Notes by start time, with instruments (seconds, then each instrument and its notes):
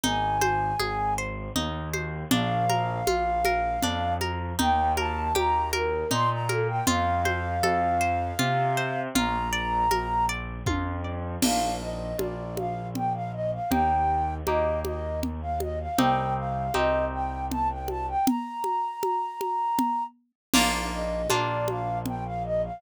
0.03 acoustic grand piano G#1, orchestral harp D#4, flute G#5, low conga
0.41 orchestral harp C5, high conga
0.79 acoustic grand piano G#1, orchestral harp G#4, high conga
1.18 orchestral harp C5
1.56 acoustic grand piano D#2, orchestral harp D#4, low conga
1.94 orchestral harp C5, high conga
2.31 acoustic grand piano A#1, orchestral harp D4, flute F5, low conga
2.69 orchestral harp A#4, high conga
3.07 acoustic grand piano A#1, orchestral harp F4, high conga
3.45 orchestral harp A#4, high conga
3.82 acoustic grand piano F2, orchestral harp D4, low conga
4.21 orchestral harp A#4, high conga
4.59 acoustic grand piano D#2, orchestral harp D#4, flute G5, low conga
4.97 orchestral harp A#4, flute A5, high conga
5.35 acoustic grand piano D#2, orchestral harp G4, flute A#5, high conga
5.73 orchestral harp A#4, flute A#4, high conga
6.11 acoustic grand piano A#2, orchestral harp D#4, flute C6, low conga
6.30 flute A#5
6.49 flute A4, orchestral harp A#4, high conga
6.68 flute G5
6.87 acoustic grand piano F2, orchestral harp F4, flute F5, low conga
7.25 orchestral harp C5, high conga
7.63 acoustic grand piano F2, orchestral harp A4, high conga
8.01 orchestral harp C5
8.39 acoustic grand piano C3, orchestral harp F4, low conga
8.77 orchestral harp C5
9.15 acoustic grand piano A#1, orchestral harp F4, flute A#5, low conga
9.53 orchestral harp D5
9.91 acoustic grand piano A#1, orchestral harp A#4, high conga
10.29 orchestral harp D5
10.66 acoustic grand piano F2, orchestral harp F4, kick, high tom
11.04 orchestral harp D5
11.42 acoustic grand piano A#1, orchestral harp A#3 D4 F4, flute F5, crash, low conga
11.81 flute D#5
12.18 acoustic grand piano A#1, orchestral harp A#3 D4 F4, flute D5, high conga
12.57 flute F5, high conga
12.95 flute G5, low conga
13.14 flute F5
13.33 flute D#5
13.52 flute F5
13.71 acoustic grand piano D#2, orchestral harp A#3 D#4 G4, flute G5, low conga
14.47 acoustic grand piano D#2, orchestral harp A#3 D#4 G4, flute D#5, high conga
14.84 flute D#5, high conga
15.23 low conga
15.42 flute F5
15.60 flute D#5, high conga
15.79 flute F5
15.98 acoustic grand piano C2, orchestral harp C4 D#4 G4, flute G5, low conga
16.37 flute F5
16.74 acoustic grand piano C2, orchestral harp C4 D#4 G4, flute D#5, high conga
17.12 flute G5
17.50 flute A5, low conga
17.69 flute G5
17.88 flute A5, high conga
18.07 flute G5
18.26 flute A#5, low conga
18.64 high conga
19.03 high conga
19.41 high conga
19.79 low conga
20.54 acoustic grand piano A#1, orchestral harp A#3 D4 F4, flute F5, crash, low conga
20.92 flute D#5
21.30 acoustic grand piano A#1, orchestral harp A#3 D4 F4, flute D5, high conga
21.68 flute F5, high conga
22.06 flute G5, low conga
22.25 flute F5
22.44 flute D#5
22.63 flute F5